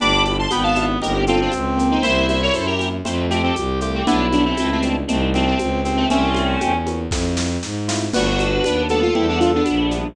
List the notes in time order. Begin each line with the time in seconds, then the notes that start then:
0.00 G1 B3 D4 E4 G4 B5 D6, low conga, shaker
0.24 B5 D6, high conga, shaker
0.39 A5 C6
0.51 G#1 B3 G5 B5, high conga, shaker
0.63 F5 A5
0.75 B3 D4 E4 G4, high conga, shaker
1.01 G1 A#3 C4 D#4 G4 A#4, low conga, shaker
1.27 C4 F4 A4, high conga, shaker
1.41 D4 F4
1.52 C#2, high conga, shaker
1.77 A#3 C4 D#4 G4, shaker
1.91 C4 D#4
2.02 C2 A#3 C4 C#4 E4 C5 E5, low conga, shaker
2.28 C5 E5, high conga, shaker
2.42 A#4 C#5
2.54 F#2 A4 C5, high conga, shaker
2.67 G4 A#4
2.79 A#3 C4 C#4 E4, high conga, shaker
3.04 F2 A3 C4 E4 F4, low conga, shaker
3.30 A3 C4 G4, high conga, shaker
3.43 A3 C4
3.56 C2, high conga, shaker
3.81 A3 C4 E4 F4 G4, shaker
3.94 A3 C4
4.06 B1 G3 B3 D4 E4, low conga, shaker
4.32 B3 D4, high conga, shaker
4.45 A3 C4
4.57 C#2 A3 C4, high conga, shaker
4.72 A3 C4
4.82 G3 B3 D4 E4, high conga, shaker
5.07 C2 G3 A3 A#3 C4 D#4, low conga, shaker
5.34 A3 C4, high conga, shaker
5.46 A3 C4
5.59 C#2, high conga, shaker
5.85 G3 A#3 C4 D#4, shaker
5.96 A3 C4
6.10 C2 A3 A#3 C4 C#4 E4, low conga, shaker
6.35 high conga, shaker
6.61 E2, high conga, shaker
6.86 A#3 C4 C#4 E4, high conga, shaker
7.11 F2 A3 C4 E4 F4, kick, snare
7.37 snare
7.63 G#2, snare
7.88 A3 C4 E4 F4, snare
8.13 G1 G3 A3 B3 D4 F#4 B4, crash, low conga, shaker
8.39 high conga, shaker
8.64 D#2 B3 D4, high conga, shaker
8.89 G3 A3 B3 D4 F#4 A4, high conga, shaker
9.02 F4
9.15 E2 G3 B3 C4 D4 E4, low conga
9.28 B3 D4
9.39 D4 F4, high conga, shaker
9.55 B3 D4
9.66 A#1, high conga, shaker
9.91 G3 B3 D4 E4, shaker